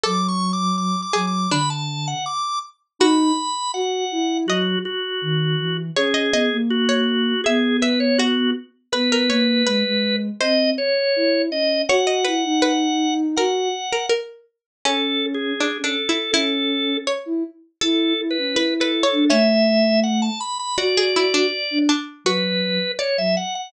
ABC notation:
X:1
M:2/4
L:1/16
Q:1/4=81
K:A
V:1 name="Drawbar Organ"
(3d'2 c'2 d'2 (3d'2 d'2 d'2 | b a2 f d'2 z2 | [K:B] b4 f4 | F2 F6 |
G4 F4 | G2 B c F2 z2 | B8 | d2 c4 d2 |
f8 | f4 z4 | [K:A] (3A4 G4 A4 | A4 z4 |
(3A4 B4 A4 | e4 f a b b | d6 z2 | B4 c e f f |]
V:2 name="Pizzicato Strings"
A6 G2 | D2 z6 | [K:B] F2 z6 | d2 z6 |
c d d2 z c2 z | e2 e2 F2 z2 | B A c z B4 | ^B4 z4 |
c d B z B4 | A3 A A2 z2 | [K:A] C2 z2 (3D2 D2 E2 | E4 c4 |
A2 z2 (3B2 B2 c2 | C4 z4 | F G E D z2 D2 | F4 d4 |]
V:3 name="Ocarina"
F,6 F,2 | D,4 z4 | [K:B] D2 z2 F2 E2 | F,2 z2 D,2 E,2 |
C2 B, A,5 | B,6 z2 | B,2 A,2 G, G,3 | ^B,2 z2 E2 C2 |
F2 E D5 | F2 z6 | [K:A] C4 z C z2 | C4 z E z2 |
E2 E C E3 D | A,6 z2 | F4 z D z2 | F,3 z2 F, z2 |]